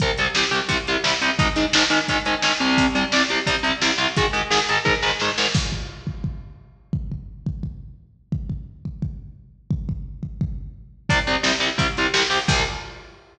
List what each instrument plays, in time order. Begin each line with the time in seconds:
0.00 overdriven guitar C2 C3 G3, kick, closed hi-hat
0.18 overdriven guitar C2 C3 G3, closed hi-hat
0.35 overdriven guitar C2 C3 G3, snare
0.51 overdriven guitar C2 C3 G3, closed hi-hat
0.69 overdriven guitar C2 C3 G3, kick, closed hi-hat
0.87 overdriven guitar C2 C3 G3, closed hi-hat
1.04 overdriven guitar C2 C3 G3, snare
1.22 overdriven guitar C2 C3 G3, closed hi-hat
1.39 overdriven guitar G#2 D#3 G#3, kick, closed hi-hat
1.56 overdriven guitar G#2 D#3 G#3, closed hi-hat
1.73 overdriven guitar G#2 D#3 G#3, snare
1.90 overdriven guitar G#2 D#3 G#3, closed hi-hat
2.08 overdriven guitar G#2 D#3 G#3, kick, closed hi-hat
2.25 overdriven guitar G#2 D#3 G#3, closed hi-hat
2.42 overdriven guitar G#2 D#3 G#3, snare
2.60 overdriven guitar C2 C3 G3, closed hi-hat
2.78 kick, closed hi-hat
2.95 overdriven guitar C2 C3 G3, closed hi-hat
3.12 overdriven guitar C2 C3 G3, snare
3.30 overdriven guitar C2 C3 G3, closed hi-hat
3.46 overdriven guitar C2 C3 G3, kick, closed hi-hat
3.63 overdriven guitar C2 C3 G3, closed hi-hat
3.82 overdriven guitar C2 C3 G3, snare
3.98 overdriven guitar C2 C3 G3, closed hi-hat
4.16 overdriven guitar G#2 D#3 G#3, kick, closed hi-hat
4.33 overdriven guitar G#2 D#3 G#3, closed hi-hat
4.50 overdriven guitar G#2 D#3 G#3, snare
4.69 overdriven guitar G#2 D#3 G#3, closed hi-hat
4.85 overdriven guitar G#2 D#3 G#3, kick, snare
5.03 overdriven guitar G#2 D#3 G#3, snare
5.20 overdriven guitar G#2 D#3 G#3, snare
5.38 overdriven guitar G#2 D#3 G#3, snare
5.54 kick, crash
5.72 kick
6.07 kick
6.24 kick
6.93 kick
7.12 kick
7.46 kick
7.63 kick
8.32 kick
8.50 kick
8.85 kick
9.02 kick
9.71 kick
9.89 kick
10.23 kick
10.41 kick
11.09 overdriven guitar C2 C3 G3, kick, closed hi-hat
11.27 overdriven guitar C2 C3 G3, closed hi-hat
11.43 overdriven guitar C2 C3 G3, snare
11.60 overdriven guitar C2 C3 G3, closed hi-hat
11.78 overdriven guitar C2 C3 G3, kick, closed hi-hat
11.97 overdriven guitar C2 C3 G3, closed hi-hat
12.14 overdriven guitar C2 C3 G3, snare
12.30 overdriven guitar C2 C3 G3, open hi-hat
12.48 overdriven guitar C2 C3 G3, kick, crash